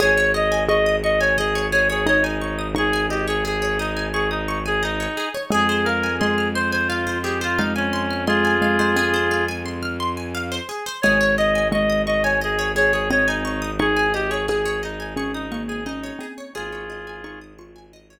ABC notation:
X:1
M:4/4
L:1/16
Q:1/4=87
K:Ab
V:1 name="Clarinet"
d2 e2 e2 e d A2 d A d E3 | A2 G A A2 E2 A E2 A E3 z | A2 B2 A2 c c F2 G F E D3 | [FA]8 z8 |
d2 e2 e2 e d A2 d A d E3 | A2 G A A2 E2 A E2 A E3 z | [FA]6 z10 |]
V:2 name="Xylophone"
A4 A8 E4 | E10 z6 | A,4 A,8 A,4 | A,2 A, A, C8 z4 |
A,4 A,8 C4 | E2 z2 A4 D2 B,2 D2 C2 | A4 E2 F6 z4 |]
V:3 name="Pizzicato Strings"
A d e a d' e' d' a e d A d e a d' e' | d' a e d A d e a d' e' d' a e d A d | A c f a c' f' c' a f c A c f a c' f' | c' a f c A c f a c' f' c' a f c A c |
A d e a d' e' d' a e d A d e a d' e' | d' a e d A d e a d' e' d' a e d A d | A d e a d' e' d' a e d z6 |]
V:4 name="Violin" clef=bass
A,,,16- | A,,,16 | F,,16- | F,,16 |
A,,,16- | A,,,16 | A,,,16 |]